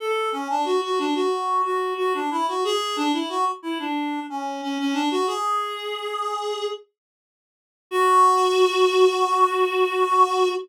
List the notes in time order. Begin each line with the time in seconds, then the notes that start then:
0.00 A4
0.32 C#4
0.50 D4
0.65 F#4
0.83 F#4
0.99 D4
1.15 F#4
1.65 F#4
1.98 F#4
2.14 D4
2.31 E4
2.48 F#4
2.64 G#4
2.96 D4
3.13 E4
3.29 F#4
3.63 E4
3.79 D4
4.30 C#4
4.62 C#4
4.79 C#4
4.93 D4
5.11 F#4
5.27 G#4
7.91 F#4